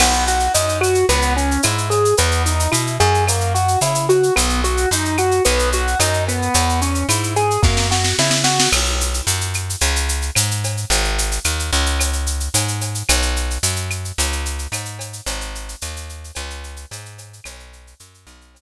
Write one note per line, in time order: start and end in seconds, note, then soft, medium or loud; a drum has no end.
0.00 0.49 B1 loud
0.00 0.24 B3 medium
0.00 crash medium
0.00 cowbell medium
0.00 claves medium
0.13 shaker medium
0.27 0.52 F#4 medium
0.27 shaker medium
0.40 shaker medium
0.54 1.04 F#2 medium
0.54 0.79 D#4 medium
0.54 shaker medium
0.69 shaker medium
0.81 1.05 F#4 medium
0.81 claves medium
0.81 shaker medium
0.95 shaker medium
1.09 1.58 C#2 loud
1.09 1.34 B3 loud
1.09 cowbell medium
1.09 shaker medium
1.22 shaker medium
1.36 1.61 C#4 medium
1.36 shaker medium
1.51 shaker medium
1.63 2.14 G#2 medium
1.63 1.88 E4 medium
1.63 cowbell medium
1.63 claves medium
1.63 shaker medium
1.78 shaker medium
1.90 2.15 G#4 medium
1.90 cowbell medium
1.90 shaker medium
2.05 shaker medium
2.17 2.68 E2 loud
2.17 2.43 B3 medium
2.17 cowbell medium
2.17 shaker medium
2.31 shaker medium
2.45 2.70 D#4 medium
2.45 shaker medium
2.60 shaker medium
2.71 2.98 B2 medium
2.71 2.96 E4 medium
2.71 claves medium
2.71 shaker medium
2.87 shaker medium
3.00 3.77 F#2 loud
3.00 3.24 G#4 medium
3.00 shaker medium
3.14 shaker medium
3.27 3.53 A#3 medium
3.27 cowbell medium
3.27 claves medium
3.27 shaker medium
3.40 shaker medium
3.54 3.79 F#4 medium
3.54 shaker medium
3.68 shaker medium
3.81 4.30 C#3 medium
3.81 4.06 E4 medium
3.81 cowbell medium
3.81 shaker medium
3.95 shaker medium
4.09 4.34 F#4 medium
4.09 cowbell medium
4.09 shaker medium
4.23 shaker medium
4.36 4.86 B1 loud
4.36 4.60 B3 medium
4.36 cowbell medium
4.36 claves medium
4.36 shaker medium
4.49 shaker medium
4.64 4.89 F#4 medium
4.64 shaker medium
4.77 shaker medium
4.91 5.40 F#2 medium
4.91 5.17 D#4 medium
4.91 shaker medium
5.05 shaker medium
5.18 5.43 F#4 medium
5.18 claves medium
5.18 shaker medium
5.31 shaker medium
5.45 5.95 B1 loud
5.45 5.70 B3 loud
5.45 cowbell medium
5.45 shaker medium
5.59 shaker medium
5.72 5.98 F#4 medium
5.72 shaker medium
5.87 shaker medium
5.99 6.49 F#2 loud
5.99 6.24 D#4 medium
5.99 cowbell medium
5.99 claves medium
5.99 shaker medium
6.13 shaker medium
6.27 6.80 B3 medium
6.27 cowbell medium
6.27 shaker medium
6.42 shaker medium
6.54 7.04 E2 loud
6.54 cowbell medium
6.54 shaker medium
6.69 shaker medium
6.81 7.06 C#4 medium
6.81 shaker medium
6.95 shaker medium
7.09 7.58 G#2 medium
7.09 7.34 E4 medium
7.09 claves medium
7.09 shaker medium
7.23 shaker medium
7.36 7.61 G#4 medium
7.36 shaker medium
7.51 shaker medium
7.63 8.13 F#2 loud
7.63 7.87 A#3 medium
7.63 kick medium
7.63 snare medium
7.77 snare medium
7.91 8.16 F#4 medium
7.91 snare medium
8.04 snare medium
8.19 8.68 C#3 medium
8.19 8.44 E4 medium
8.19 snare medium
8.31 snare medium
8.44 8.69 F#4 medium
8.44 snare medium
8.60 snare medium
8.72 9.21 B1 loud
8.72 crash medium
8.72 cowbell medium
8.72 claves loud
8.85 shaker medium
9.01 shaker medium
9.14 shaker medium
9.27 9.76 F#2 medium
9.27 shaker medium
9.41 shaker medium
9.54 claves medium
9.54 shaker medium
9.70 shaker medium
9.81 10.31 C#2 loud
9.81 cowbell medium
9.81 shaker medium
9.96 shaker medium
10.09 shaker medium
10.22 shaker medium
10.35 10.85 G#2 medium
10.35 cowbell medium
10.35 claves medium
10.35 shaker loud
10.51 shaker medium
10.64 cowbell medium
10.64 shaker medium
10.77 shaker medium
10.90 11.39 G#1 loud
10.90 cowbell medium
10.90 shaker medium
11.04 shaker medium
11.18 shaker medium
11.31 shaker medium
11.44 11.71 D#2 medium
11.44 claves medium
11.44 shaker medium
11.59 shaker medium
11.73 12.49 C#2 loud
11.73 shaker medium
11.86 shaker medium
12.00 cowbell medium
12.00 claves medium
12.00 shaker medium
12.13 shaker medium
12.26 shaker medium
12.40 shaker medium
12.54 13.03 G#2 medium
12.54 cowbell medium
12.54 shaker medium
12.68 shaker medium
12.81 cowbell medium
12.81 shaker medium
12.95 shaker medium
13.09 13.58 B1 loud
13.09 cowbell medium
13.09 claves medium
13.09 shaker medium
13.22 shaker medium
13.36 shaker medium
13.50 shaker medium
13.63 14.12 F#2 medium
13.63 shaker loud
13.76 shaker medium
13.90 claves medium
13.90 shaker medium
14.05 shaker medium
14.18 14.67 C#2 loud
14.18 cowbell medium
14.18 shaker loud
14.32 shaker medium
14.45 shaker medium
14.59 shaker medium
14.72 15.21 G#2 medium
14.72 cowbell medium
14.72 claves medium
14.72 shaker medium
14.85 shaker medium
14.99 cowbell medium
14.99 shaker medium
15.13 shaker medium
15.26 15.75 G#1 loud
15.26 cowbell medium
15.26 shaker medium
15.41 shaker medium
15.55 shaker medium
15.69 shaker medium
15.81 16.31 D#2 loud
15.81 claves medium
15.81 shaker medium
15.96 shaker medium
16.09 shaker medium
16.24 shaker medium
16.35 16.86 C#2 loud
16.35 cowbell medium
16.35 claves medium
16.35 shaker medium
16.50 shaker medium
16.64 shaker medium
16.76 shaker medium
16.91 17.40 G#2 loud
16.91 cowbell medium
16.91 shaker medium
17.05 shaker medium
17.18 cowbell medium
17.18 shaker medium
17.33 shaker medium
17.44 17.94 B1 loud
17.44 cowbell medium
17.44 claves loud
17.44 shaker medium
17.60 shaker medium
17.73 shaker medium
17.87 shaker medium
18.00 18.26 F#2 medium
18.00 shaker medium
18.14 shaker medium
18.27 18.61 B1 loud
18.27 claves medium
18.27 shaker medium
18.41 shaker medium
18.55 cowbell medium
18.55 shaker medium